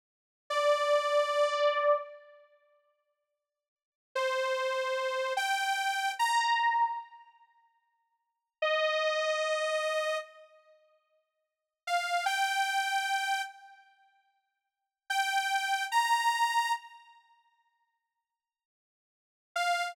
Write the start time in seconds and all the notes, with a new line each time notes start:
0.50 D5
4.15 C5
5.37 G5
6.19 A#5
8.62 D#5
11.87 F5
12.26 G5
15.10 G5
15.92 A#5
19.56 F5